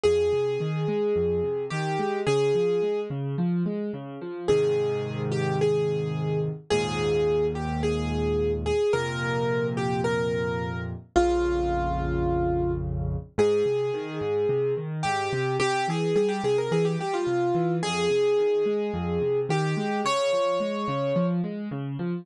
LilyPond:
<<
  \new Staff \with { instrumentName = "Acoustic Grand Piano" } { \time 4/4 \key aes \major \tempo 4 = 108 aes'2. g'4 | aes'4. r2 r8 | aes'4. g'8 aes'4. r8 | aes'4. g'8 aes'4. aes'8 |
bes'4. g'8 bes'4. r8 | f'2. r4 | aes'2. g'4 | g'8 aes'8 aes'16 g'16 aes'16 bes'16 aes'16 g'16 g'16 f'4~ f'16 |
aes'2. g'4 | des''2~ des''8 r4. | }
  \new Staff \with { instrumentName = "Acoustic Grand Piano" } { \clef bass \time 4/4 \key aes \major f,8 c8 ees8 aes8 f,8 c8 ees8 aes8 | des8 f8 aes8 des8 f8 aes8 des8 f8 | <aes, c ees>1 | <ees, aes, bes,>1 |
<f, bes, c>1 | <bes,, f, des>1 | aes,8 c8 ees8 aes,8 c8 ees8 aes,8 c8 | c8 e8 g8 c8 e8 g8 c8 e8 |
f,8 c8 ees8 aes8 f,8 c8 ees8 aes8 | des8 f8 aes8 des8 f8 aes8 des8 f8 | }
>>